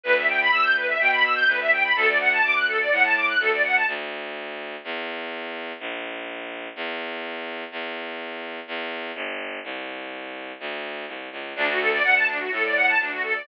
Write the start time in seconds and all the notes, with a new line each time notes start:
0.04 D2 B4
0.16 E5
0.28 G5
0.40 B5
0.52 D2 E6
0.63 G6
0.76 B4
0.88 E5
0.99 B2 G5
1.12 B5
1.23 E6
1.36 G6
1.47 D2 B4
1.60 E5
1.72 G5
1.84 B5
1.96 D2 A4
2.08 D5
2.20 F#5
2.32 A5
2.44 D2 D6
2.55 F#6
2.68 A4
2.80 D5
2.91 A2 F#5
3.04 A5
3.16 D6
3.28 F#6
3.40 D2 A4
3.52 D5
3.64 F#5
3.75 A5
3.88 D2
4.84 E2
5.80 A#1
6.76 E2
7.71 E2
8.68 E2
9.15 G1
9.64 C2
10.60 D2
11.08 C2
11.32 C#2
11.56 D2 D4
11.68 F#4
11.79 A4
11.92 D5
12.04 D2 F#5
12.16 A5
12.28 D4
12.40 F#4
12.51 A2 A4
12.64 D5
12.76 F#5
12.88 A5
12.99 D2 D4
13.12 F#4
13.23 A4
13.35 D5